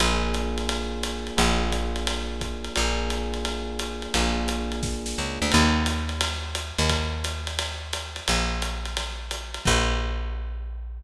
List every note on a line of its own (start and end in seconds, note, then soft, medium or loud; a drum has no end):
0.00 1.31 A#1 medium
0.00 1.37 A#3 loud
0.00 1.37 D4 medium
0.00 1.37 F4 medium
0.00 1.37 G#4 loud
0.00 ride loud
0.34 hi-hat pedal medium
0.34 ride medium
0.58 ride medium
0.69 ride loud
1.03 hi-hat pedal loud
1.03 ride loud
1.27 ride medium
1.37 2.69 A#1 loud
1.37 2.73 A#3 medium
1.37 2.73 D4 medium
1.37 2.73 F4 medium
1.37 2.73 G#4 medium
1.37 ride loud
1.72 kick medium
1.72 hi-hat pedal medium
1.72 ride medium
1.96 ride medium
2.07 ride loud
2.41 kick medium
2.41 hi-hat pedal medium
2.41 ride medium
2.64 ride medium
2.76 4.08 A#1 medium
2.76 4.12 A#3 medium
2.76 4.12 D4 medium
2.76 4.12 F4 medium
2.76 4.12 G#4 loud
2.76 ride loud
3.10 hi-hat pedal medium
3.10 ride medium
3.34 ride medium
3.45 ride loud
3.79 hi-hat pedal loud
3.79 ride loud
4.02 ride medium
4.14 5.14 A#1 medium
4.14 5.51 A#3 medium
4.14 5.51 D4 medium
4.14 5.51 F4 medium
4.14 5.51 G#4 medium
4.14 kick medium
4.14 ride loud
4.48 hi-hat pedal loud
4.48 ride loud
4.72 ride medium
4.83 kick loud
4.83 snare medium
5.06 snare medium
5.18 5.39 C#2 medium
5.42 5.52 D2 medium
5.52 6.72 D#2 loud
5.52 kick medium
5.52 crash loud
5.52 ride loud
5.86 hi-hat pedal loud
5.86 ride loud
6.09 ride medium
6.21 ride loud
6.55 hi-hat pedal loud
6.55 ride loud
6.78 8.21 D#2 medium
6.78 ride medium
6.89 kick medium
6.89 ride loud
7.24 hi-hat pedal loud
7.24 ride loud
7.47 ride medium
7.59 ride loud
7.93 hi-hat pedal medium
7.93 ride loud
8.16 ride medium
8.28 9.59 A#1 medium
8.28 ride loud
8.62 hi-hat pedal loud
8.62 ride loud
8.85 ride medium
8.97 ride loud
9.31 hi-hat pedal loud
9.31 ride loud
9.54 ride medium
9.65 11.01 A#1 loud
9.65 kick loud
9.65 crash loud